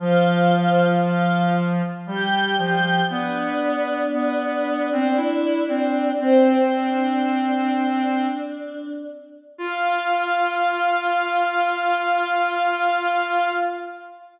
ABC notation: X:1
M:3/4
L:1/16
Q:1/4=58
K:F
V:1 name="Choir Aahs"
[F,F]4 [Ff]2 z2 [Gg]2 [Gg]2 | [Dd]12 | "^rit." [Cc]2 [Dd]8 z2 | f12 |]
V:2 name="Lead 1 (square)"
F,8 G,2 F,2 | =B,4 B,3 C E2 C2 | "^rit." C8 z4 | F12 |]